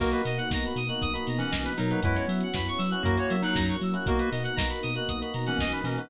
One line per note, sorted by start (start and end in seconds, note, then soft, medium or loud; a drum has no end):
0.00 0.14 B1 loud
0.00 0.10 A#3 medium
0.00 0.22 A#3 medium
0.00 2.01 A#3 medium
0.00 0.10 B3 medium
0.00 2.01 B3 medium
0.00 0.10 D#4 medium
0.00 2.01 D#4 medium
0.00 0.10 F#4 medium
0.00 0.22 F#4 medium
0.00 2.01 F#4 medium
0.00 0.10 A#4 loud
0.00 kick loud
0.00 crash loud
0.12 0.44 A#3 medium
0.12 0.44 B3 medium
0.12 0.44 D#4 medium
0.12 0.44 F#4 medium
0.12 0.23 B4 medium
0.12 closed hi-hat medium
0.25 0.39 B2 medium
0.25 0.37 D#5 medium
0.25 open hi-hat loud
0.37 0.49 F#5 medium
0.37 closed hi-hat medium
0.50 0.65 B1 medium
0.50 0.81 A#3 medium
0.50 0.81 B3 medium
0.50 0.81 D#4 medium
0.50 0.81 F#4 medium
0.50 0.64 A#5 medium
0.50 kick loud
0.50 snare loud
0.63 0.77 B5 medium
0.63 closed hi-hat medium
0.76 0.90 B2 medium
0.76 0.88 D#6 medium
0.76 open hi-hat medium
0.88 1.09 A#3 medium
0.88 1.09 B3 medium
0.88 1.09 D#4 medium
0.88 1.09 F#4 medium
0.88 1.00 F#6 medium
0.88 closed hi-hat medium
1.01 1.17 B1 loud
1.01 1.13 D#6 medium
1.01 kick loud
1.01 closed hi-hat loud
1.13 1.54 A#3 medium
1.13 1.54 B3 medium
1.13 1.54 D#4 medium
1.13 1.54 F#4 medium
1.13 1.25 B5 medium
1.13 closed hi-hat medium
1.27 1.42 B2 medium
1.27 1.40 A#5 medium
1.27 open hi-hat loud
1.38 1.73 E3 medium
1.38 1.73 C#4 medium
1.38 1.51 F#5 medium
1.38 closed hi-hat medium
1.51 1.67 B1 medium
1.51 1.62 D#5 medium
1.51 kick medium
1.51 snare loud
1.65 1.76 B4 medium
1.65 closed hi-hat medium
1.78 1.93 B2 loud
1.78 2.01 F#3 medium
1.78 2.01 D#4 medium
1.78 1.90 A#4 medium
1.78 open hi-hat loud
1.91 2.01 A#3 medium
1.91 2.01 B3 medium
1.91 2.01 D#4 medium
1.91 2.01 F#4 medium
1.91 2.02 B4 medium
1.91 closed hi-hat medium
2.03 2.17 F#2 loud
2.03 2.26 G#3 medium
2.03 3.03 B3 medium
2.03 2.14 B3 loud
2.03 3.03 C#4 loud
2.03 2.14 C#4 medium
2.03 3.03 E4 medium
2.03 2.14 E4 medium
2.03 2.26 E4 medium
2.03 3.03 F#4 medium
2.03 2.14 F#4 medium
2.03 2.15 B4 medium
2.03 kick loud
2.03 closed hi-hat loud
2.15 2.47 B3 medium
2.15 2.47 C#4 medium
2.15 2.47 E4 medium
2.15 2.47 F#4 medium
2.15 2.26 C#5 medium
2.15 closed hi-hat medium
2.28 2.42 F#3 medium
2.28 2.39 E5 medium
2.28 open hi-hat loud
2.40 2.54 F#5 medium
2.40 closed hi-hat medium
2.54 2.68 F#2 medium
2.54 2.84 B3 medium
2.54 2.84 C#4 medium
2.54 2.84 E4 medium
2.54 2.84 F#4 medium
2.54 2.67 B5 medium
2.54 kick loud
2.54 snare loud
2.67 2.79 C#6 medium
2.67 closed hi-hat medium
2.78 2.93 F#3 medium
2.78 2.90 E6 medium
2.78 open hi-hat medium
2.91 3.02 B3 medium
2.91 3.02 C#4 medium
2.91 3.02 E4 medium
2.91 3.02 F#4 medium
2.91 3.02 F#6 medium
2.91 closed hi-hat medium
3.03 3.18 F#2 loud
3.03 3.37 A#3 medium
3.03 3.15 A#3 loud
3.03 4.07 A#3 medium
3.03 3.15 C#4 medium
3.03 4.07 C#4 medium
3.03 3.15 E4 medium
3.03 4.07 E4 medium
3.03 3.37 F#4 medium
3.03 3.15 F#4 loud
3.03 4.07 F#4 medium
3.03 3.15 A#4 medium
3.03 kick loud
3.03 closed hi-hat loud
3.17 3.58 A#3 medium
3.17 3.58 C#4 medium
3.17 3.58 E4 medium
3.17 3.58 F#4 medium
3.17 3.30 C#5 medium
3.17 closed hi-hat medium
3.30 3.45 F#3 medium
3.30 3.42 E5 medium
3.30 open hi-hat medium
3.42 3.77 F#3 medium
3.42 3.77 D#4 medium
3.42 3.55 F#5 medium
3.42 closed hi-hat medium
3.55 3.70 F#2 medium
3.55 3.66 A#5 medium
3.55 kick loud
3.55 snare loud
3.68 3.81 C#6 medium
3.68 closed hi-hat medium
3.81 3.95 F#3 medium
3.81 3.94 E6 medium
3.81 open hi-hat medium
3.94 4.04 A#3 medium
3.94 4.04 C#4 medium
3.94 4.04 E4 medium
3.94 4.04 F#4 medium
3.94 4.06 F#6 medium
3.94 closed hi-hat medium
4.06 4.20 B1 loud
4.06 4.17 A#3 loud
4.06 6.09 A#3 medium
4.06 4.30 A#3 medium
4.06 4.17 B3 medium
4.06 6.09 B3 medium
4.06 4.17 D#4 medium
4.06 6.09 D#4 loud
4.06 4.17 F#4 medium
4.06 6.09 F#4 medium
4.06 4.30 F#4 medium
4.06 4.18 A#4 medium
4.06 kick loud
4.06 closed hi-hat loud
4.19 4.50 A#3 medium
4.19 4.50 B3 medium
4.19 4.50 D#4 medium
4.19 4.50 F#4 medium
4.19 4.30 B4 medium
4.19 closed hi-hat medium
4.31 4.46 B2 medium
4.31 4.43 D#5 medium
4.31 open hi-hat loud
4.43 4.55 F#5 medium
4.43 closed hi-hat medium
4.56 4.72 B1 medium
4.56 4.88 A#3 medium
4.56 4.88 B3 medium
4.56 4.88 D#4 medium
4.56 4.88 F#4 medium
4.56 4.67 A#5 medium
4.56 kick loud
4.56 snare loud
4.69 4.81 B5 medium
4.69 closed hi-hat medium
4.82 4.98 B2 medium
4.82 4.94 D#6 medium
4.82 open hi-hat medium
4.95 5.16 A#3 medium
4.95 5.16 B3 medium
4.95 5.16 D#4 medium
4.95 5.16 F#4 medium
4.95 5.07 F#6 medium
4.95 closed hi-hat medium
5.08 5.23 B1 medium
5.08 5.20 D#6 medium
5.08 kick medium
5.08 closed hi-hat loud
5.21 5.62 A#3 medium
5.21 5.62 B3 medium
5.21 5.62 D#4 medium
5.21 5.62 F#4 medium
5.21 5.32 B5 medium
5.21 closed hi-hat medium
5.34 5.48 B2 medium
5.34 5.45 A#5 medium
5.34 open hi-hat medium
5.46 5.82 E3 medium
5.46 5.82 C#4 medium
5.46 5.58 F#5 medium
5.46 closed hi-hat medium
5.58 5.72 B1 loud
5.58 5.72 D#5 medium
5.58 kick loud
5.58 snare loud
5.72 5.84 B4 medium
5.72 closed hi-hat medium
5.84 5.98 B2 medium
5.84 6.08 E3 medium
5.84 6.08 C#4 medium
5.84 5.96 A#4 medium
5.84 open hi-hat medium
5.97 6.08 A#3 medium
5.97 6.08 B3 medium
5.97 6.08 D#4 medium
5.97 6.08 F#4 medium
5.97 6.08 B4 medium
5.97 closed hi-hat medium